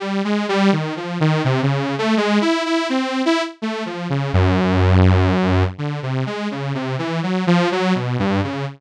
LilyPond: \new Staff { \time 4/4 \tempo 4 = 83 \tuplet 3/2 { g8 gis8 g8 dis8 f8 dis8 } c16 cis8 a16 \tuplet 3/2 { gis8 e'8 e'8 } | c'8 e'16 r16 \tuplet 3/2 { a8 f8 cis8 } fis,2 | \tuplet 3/2 { d8 c8 gis8 cis8 c8 e8 fis8 f8 fis8 b,8 g,8 cis8 } | }